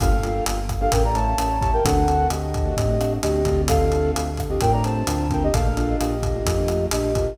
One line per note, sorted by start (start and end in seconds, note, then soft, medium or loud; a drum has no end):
0.00 0.41 G1 loud
0.00 0.09 A#3 medium
0.00 0.09 D4 medium
0.00 0.09 F4 loud
0.00 0.09 G4 medium
0.00 0.44 A4 medium
0.00 0.44 F5 loud
0.00 kick loud
0.00 cross-stick loud
0.00 closed hi-hat loud
0.12 0.21 A#3 medium
0.12 0.21 D4 medium
0.12 0.21 F4 medium
0.12 0.21 G4 medium
0.23 0.60 A#3 medium
0.23 0.60 D4 medium
0.23 0.60 F4 medium
0.23 0.60 G4 medium
0.23 closed hi-hat medium
0.46 0.88 G1 medium
0.46 closed hi-hat loud
0.69 kick medium
0.69 cross-stick medium
0.69 closed hi-hat medium
0.81 0.90 A#3 medium
0.81 0.90 D4 medium
0.81 0.90 F4 medium
0.81 0.90 G4 medium
0.81 0.92 A4 medium
0.81 0.92 F5 medium
0.92 1.35 A1 medium
0.92 1.02 A3 medium
0.92 1.02 C#4 medium
0.92 1.02 E4 medium
0.92 1.02 G4 medium
0.92 1.03 A#4 medium
0.92 1.03 G5 medium
0.92 kick medium
0.92 closed hi-hat loud
1.04 1.13 A3 medium
1.04 1.13 C#4 medium
1.04 1.13 E4 medium
1.04 1.13 G4 medium
1.04 1.15 D5 medium
1.04 1.15 A#5 medium
1.15 1.34 A3 medium
1.15 1.34 C#4 medium
1.15 1.34 E4 medium
1.15 1.34 G4 medium
1.15 1.59 C#5 medium
1.15 1.59 A5 medium
1.15 closed hi-hat medium
1.38 1.80 A1 medium
1.38 1.57 A3 medium
1.38 1.57 C#4 medium
1.38 1.57 E4 medium
1.38 1.57 G4 medium
1.38 cross-stick medium
1.38 closed hi-hat loud
1.60 1.80 A3 medium
1.60 1.80 C#4 medium
1.60 1.80 E4 medium
1.60 1.80 G4 medium
1.60 1.71 C#5 medium
1.60 1.71 A5 medium
1.60 kick medium
1.60 closed hi-hat medium
1.73 1.84 A#4 medium
1.73 1.84 G5 medium
1.84 2.26 D2 medium
1.84 1.94 A3 medium
1.84 1.94 C4 medium
1.84 1.94 D4 medium
1.84 1.94 F#4 medium
1.84 2.27 A4 medium
1.84 2.27 F#5 medium
1.84 kick medium
1.84 closed hi-hat loud
1.96 2.05 A3 medium
1.96 2.05 C4 medium
1.96 2.05 D4 medium
1.96 2.05 F#4 medium
2.08 2.45 A3 medium
2.08 2.45 C4 medium
2.08 2.45 D4 medium
2.08 2.45 F#4 medium
2.08 closed hi-hat medium
2.30 2.72 D2 medium
2.30 3.13 G4 medium
2.30 3.13 D#5 medium
2.30 cross-stick medium
2.30 closed hi-hat medium
2.54 kick medium
2.54 closed hi-hat medium
2.65 2.75 A3 medium
2.65 2.75 C4 medium
2.65 2.75 D4 medium
2.65 2.75 F#4 medium
2.77 3.19 A2 medium
2.77 2.86 A3 medium
2.77 2.86 C4 medium
2.77 2.86 D4 medium
2.77 2.86 F#4 medium
2.77 kick medium
2.77 closed hi-hat medium
2.89 2.98 A3 medium
2.89 2.98 C4 medium
2.89 2.98 D4 medium
2.89 2.98 F#4 medium
3.00 3.19 A3 medium
3.00 3.19 C4 medium
3.00 3.19 D4 medium
3.00 3.19 F#4 medium
3.00 cross-stick medium
3.00 closed hi-hat medium
3.22 3.45 D2 medium
3.22 3.41 A3 medium
3.22 3.41 C4 medium
3.22 3.41 D4 medium
3.22 3.41 F#4 medium
3.22 3.61 G4 medium
3.22 3.61 D#5 loud
3.22 closed hi-hat loud
3.45 4.11 D2 medium
3.45 3.79 A3 medium
3.45 3.79 C4 medium
3.45 3.79 D4 medium
3.45 3.79 F4 medium
3.45 kick medium
3.45 closed hi-hat medium
3.68 4.11 A4 loud
3.68 4.11 F5 loud
3.68 kick medium
3.68 cross-stick loud
3.68 closed hi-hat loud
3.81 3.90 A3 medium
3.81 3.90 C4 medium
3.81 3.90 D4 medium
3.81 3.90 F4 medium
3.92 4.29 A3 medium
3.92 4.29 C4 medium
3.92 4.29 D4 medium
3.92 4.29 F4 medium
3.92 closed hi-hat medium
4.15 4.57 D2 medium
4.15 closed hi-hat loud
4.37 kick medium
4.37 cross-stick medium
4.37 closed hi-hat medium
4.50 4.59 A3 medium
4.50 4.59 C4 medium
4.50 4.59 D4 medium
4.50 4.59 F4 medium
4.50 4.61 G4 medium
4.50 4.61 D#5 medium
4.61 5.03 A2 medium
4.61 4.71 A3 medium
4.61 4.71 C4 medium
4.61 4.71 D4 medium
4.61 4.71 F4 medium
4.61 4.72 A#4 medium
4.61 4.72 G5 medium
4.61 kick medium
4.61 closed hi-hat loud
4.72 4.82 A3 medium
4.72 4.82 C4 medium
4.72 4.82 D4 medium
4.72 4.82 F4 medium
4.72 4.83 D5 medium
4.72 4.83 A#5 medium
4.84 5.03 A3 medium
4.84 5.03 C4 medium
4.84 5.03 D4 medium
4.84 5.03 F4 medium
4.84 5.28 C5 medium
4.84 5.28 A5 medium
4.84 closed hi-hat medium
5.07 5.49 D2 medium
5.07 5.26 A3 medium
5.07 5.26 C4 medium
5.07 5.26 D4 medium
5.07 5.26 F4 medium
5.07 cross-stick medium
5.07 closed hi-hat loud
5.30 5.49 A3 medium
5.30 5.49 C4 medium
5.30 5.49 D4 medium
5.30 5.49 F4 medium
5.30 5.43 A#4 medium
5.30 5.43 G5 medium
5.30 kick medium
5.30 closed hi-hat medium
5.43 5.54 G4 medium
5.43 5.54 D#5 loud
5.53 5.96 A#1 loud
5.53 5.63 A3 medium
5.53 5.63 A#3 medium
5.53 5.63 D4 medium
5.53 5.63 F4 medium
5.53 5.96 A4 medium
5.53 5.96 F5 loud
5.53 kick medium
5.53 closed hi-hat loud
5.65 5.75 A3 medium
5.65 5.75 A#3 medium
5.65 5.75 D4 medium
5.65 5.75 F4 medium
5.77 6.14 A3 medium
5.77 6.14 A#3 medium
5.77 6.14 D4 medium
5.77 6.14 F4 medium
5.77 closed hi-hat medium
5.99 6.42 A#1 medium
5.99 6.85 G4 medium
5.99 6.85 D#5 medium
5.99 cross-stick loud
5.99 closed hi-hat medium
6.23 kick medium
6.23 closed hi-hat medium
6.35 6.44 A3 medium
6.35 6.44 A#3 medium
6.35 6.44 D4 medium
6.35 6.44 F4 medium
6.46 6.87 F2 medium
6.46 6.55 A3 medium
6.46 6.55 A#3 medium
6.46 6.55 D4 medium
6.46 6.55 F4 medium
6.46 kick medium
6.46 closed hi-hat loud
6.58 6.67 A3 medium
6.58 6.67 A#3 medium
6.58 6.67 D4 medium
6.58 6.67 F4 medium
6.68 6.88 A3 medium
6.68 6.88 A#3 medium
6.68 6.88 D4 medium
6.68 6.88 F4 medium
6.68 cross-stick medium
6.68 closed hi-hat medium
6.91 7.34 A#1 medium
6.91 7.11 A3 medium
6.91 7.11 A#3 medium
6.91 7.11 D4 medium
6.91 7.11 F4 medium
6.91 7.34 G4 medium
6.91 7.34 D#5 medium
6.91 closed hi-hat loud
7.15 7.34 A3 medium
7.15 7.34 A#3 medium
7.15 7.34 D4 medium
7.15 7.34 F4 medium
7.15 kick medium
7.15 closed hi-hat medium